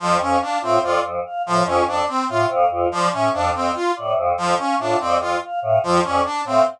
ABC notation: X:1
M:4/4
L:1/8
Q:1/4=144
K:none
V:1 name="Choir Aahs" clef=bass
F,, F,, z A,, F,, F,, z A,, | F,, F,, z A,, F,, F,, z A,, | F,, F,, z A,, F,, F,, z A,, | F,, F,, z A,, F,, F,, z A,, |]
V:2 name="Brass Section"
F, ^C D =C F z2 F, | ^C D =C F z2 F, ^C | D C F z2 F, ^C D | C F z2 F, ^C D =C |]
V:3 name="Choir Aahs"
z f f F d z f f | F d z f f F d z | f f F d z f f F | d z f f F d z f |]